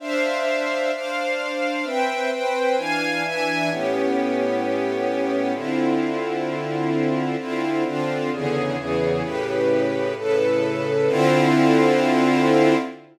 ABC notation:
X:1
M:4/4
L:1/8
Q:1/4=130
K:Ddor
V:1 name="String Ensemble 1"
[Dcef]4 [Dcdf]4 | [CBeg]2 [CBcg]2 [E,Df^g]2 [E,Deg]2 | [A,,B,^CG]8 | [D,CEF]8 |
[D,CEF]2 [D,CDF]2 [E,,^C,D,^G]2 [E,,C,E,G]2 | [A,,^C,GB]4 [A,,C,AB]4 | [D,CEF]8 |]